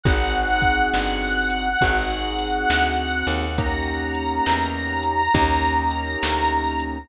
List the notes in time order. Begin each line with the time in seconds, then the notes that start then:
0.03 G#1 C4 D#4 F#4 G#4 F#5, kick, closed hi-hat
0.62 kick, closed hi-hat
0.94 G1, snare
1.50 closed hi-hat
1.81 G#1 C4 D#4 F#4 G#4, kick, closed hi-hat
2.38 closed hi-hat
2.70 D2, snare
3.27 D#2, open hi-hat
3.58 A#3 C#4 D#4 G4 A#5, kick, closed hi-hat
4.15 closed hi-hat
4.46 E2, snare
5.03 closed hi-hat
5.34 D#2 A#3 C#4 D#4 G4, kick, closed hi-hat
5.91 closed hi-hat
6.23 D2, snare
6.80 closed hi-hat